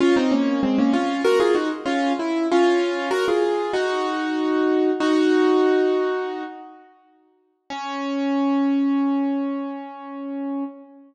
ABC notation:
X:1
M:4/4
L:1/16
Q:1/4=96
K:Db
V:1 name="Acoustic Grand Piano"
[DF] [CE] [B,D]2 [A,C] [B,D] [DF]2 [GB] [FA] [EG] z [DF]2 =E2 | [DF]4 [GB] [FA]3 [EG]8 | "^rit." [EG]10 z6 | D16 |]